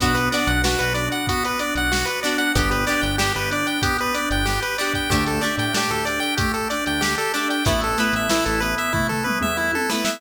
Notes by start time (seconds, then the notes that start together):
0.00 B1 B3 D4 F#4, kick, closed hi-hat
0.14 B4, closed hi-hat
0.31 B3 D4 F#4 D5, closed hi-hat
0.47 B1 F#5, closed hi-hat
0.64 B3 D4 F#4, snare
0.79 B1 B4, closed hi-hat
0.94 D4 D5, closed hi-hat
1.12 F#5, closed hi-hat
1.27 B3 F#4, kick, closed hi-hat
1.45 B4, closed hi-hat
1.59 D4 D5, closed hi-hat
1.75 B1 F#5, closed hi-hat
1.91 F#4, snare
2.05 B4, closed hi-hat
2.23 B3 D4 F#4 D5, closed hi-hat
2.38 F#5, closed hi-hat
2.55 G1 B3 D4 G4, kick, closed hi-hat
2.71 B4, closed hi-hat
2.87 B3 D4 G4 D5, closed hi-hat
3.01 G1 G5, closed hi-hat
3.18 B3 D4 G4, snare
3.35 G1 B4, closed hi-hat
3.51 D4 D5, closed hi-hat
3.67 G5, closed hi-hat
3.82 B3 G4, kick, closed hi-hat
3.98 B4, closed hi-hat
4.14 D4 D5, closed hi-hat
4.30 G1 G5, closed hi-hat
4.45 G4, snare
4.62 B4, closed hi-hat
4.78 B3 D4 G4 D5, closed hi-hat
4.94 G5, kick, closed hi-hat
5.10 D2 A3 D4 G4, kick, closed hi-hat
5.26 A4, closed hi-hat
5.41 A3 D4 G4 D5, closed hi-hat
5.58 A2 G5, closed hi-hat
5.74 A3 D4 G4, snare
5.91 D2 A4, closed hi-hat
6.05 D4 D5, closed hi-hat
6.20 G5, closed hi-hat
6.37 A3 G4, kick, closed hi-hat
6.54 A4, closed hi-hat
6.70 D4 D5, closed hi-hat
6.86 D2 G5, closed hi-hat
7.01 G4, snare
7.18 A4, closed hi-hat
7.34 A3 D4 G4 D5, closed hi-hat
7.50 G5, closed hi-hat
7.65 A1 A3 B3 E4, kick, closed hi-hat
7.81 A4, closed hi-hat
7.98 A3 B3 E4 B4, closed hi-hat
8.13 A1 E5, closed hi-hat
8.29 A3 B3 E4, snare
8.46 A1 A4, closed hi-hat
8.60 B3 B4, closed hi-hat
8.78 E5, closed hi-hat
8.93 A3 E4, kick, floor tom
9.09 A4, floor tom
9.24 B3 B4, mid tom
9.41 E2 E5, mid tom
9.57 E4
9.73 A4, high tom
9.89 A3 B3 E4 B4, snare
10.05 E5, snare